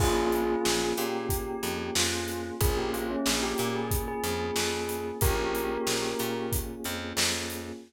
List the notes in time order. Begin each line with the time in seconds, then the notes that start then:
0.00 A#1 A#3 C#4 F4 G#4, kick, crash
0.32 closed hi-hat
0.65 A#1, snare
0.97 A#2 G4, closed hi-hat
1.29 kick, closed hi-hat
1.63 F2, closed hi-hat
1.95 F2 F4, snare
2.28 snare, closed hi-hat
2.61 A#1 A#3 C#4 F4 G#4, kick, closed hi-hat
2.77 G4
2.93 F4, closed hi-hat
3.10 C#4
3.26 A#1 G#4, snare
3.42 G4
3.58 A#2 G4, closed hi-hat
3.75 G#4
3.91 kick, closed hi-hat
4.08 G#4
4.24 F2, closed hi-hat
4.56 F2, snare
4.89 closed hi-hat
5.21 A#1 A#3 C#4 F4 G4 G#4 A#4, kick, closed hi-hat
5.55 closed hi-hat
5.87 A#1, snare
6.19 A#2, closed hi-hat
6.52 kick, closed hi-hat
6.84 F2, closed hi-hat
7.17 F2, snare
7.50 closed hi-hat